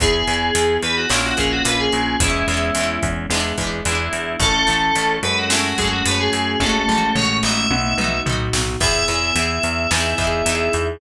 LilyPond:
<<
  \new Staff \with { instrumentName = "Electric Piano 2" } { \time 4/4 \key e \major \tempo 4 = 109 gis'4. b'16 fis'16 e'16 fis'16 gis'16 fis'16 b'16 gis'8. | e'4. r4. e'4 | a'4. b'16 fis'16 e'16 fis'16 gis'16 fis'16 b'16 gis'8. | a'4 cis''8 e''4. r4 |
e''1 | }
  \new Staff \with { instrumentName = "Electric Piano 1" } { \time 4/4 \key e \major <b e' gis'>2 <ais cis' eis'>2 | <gis b cis' e'>2 <gis b d' e'>2 | <a cis' e'>4. <gis a cis' fis'>2~ <gis a cis' fis'>8 | <gis a cis' fis'>2 <b dis' fis'>2 |
<b e' gis'>2 <b dis' e' gis'>2 | }
  \new Staff \with { instrumentName = "Pizzicato Strings" } { \time 4/4 \key e \major <b e' gis'>8 <b e' gis'>8 <b e' gis'>4 <ais cis' eis'>8 <ais cis' eis'>8 <ais cis' eis'>4 | <gis b cis' e'>8 <gis b cis' e'>8 <gis b cis' e'>4 <gis b d' e'>8 <gis b d' e'>8 <gis b d' e'>4 | <a cis' e'>8 <a cis' e'>8 <a cis' e'>4 <gis a cis' fis'>8 <gis a cis' fis'>8 <gis a cis' fis'>4 | <gis a cis' fis'>8 <gis a cis' fis'>8 <gis a cis' fis'>8 <b dis' fis'>4 <b dis' fis'>8 <b dis' fis'>4 |
<b e' gis'>8 <b e' gis'>8 <b e' gis'>4 <b dis' e' gis'>8 <b dis' e' gis'>8 <b dis' e' gis'>4 | }
  \new Staff \with { instrumentName = "Electric Bass (finger)" } { \clef bass \time 4/4 \key e \major e,8 e,8 e,8 e,8 ais,,8 ais,,8 ais,,8 ais,,8 | e,8 e,8 e,8 e,8 e,8 e,8 e,8 e,8 | a,,8 a,,8 a,,8 fis,4 fis,8 fis,8 fis,8 | a,,8 a,,8 a,,8 a,,8 b,,8 b,,8 b,,8 b,,8 |
e,8 e,8 e,8 e,8 e,8 e,8 e,8 e,8 | }
  \new DrumStaff \with { instrumentName = "Drums" } \drummode { \time 4/4 <hh bd>8 hh8 hh8 hh8 sn8 <hh bd>8 hh8 hh8 | <hh bd>8 hh8 hh8 <hh bd>8 sn8 <hh bd>8 hh8 hh8 | <hh bd>8 hh8 hh8 hh8 sn8 <hh bd>8 hh8 hh8 | <bd tommh>8 toml8 tomfh8 sn8 tommh8 toml8 tomfh8 sn8 |
<cymc bd>8 hh8 hh8 hh8 sn8 <hh bd>8 hh8 hh8 | }
>>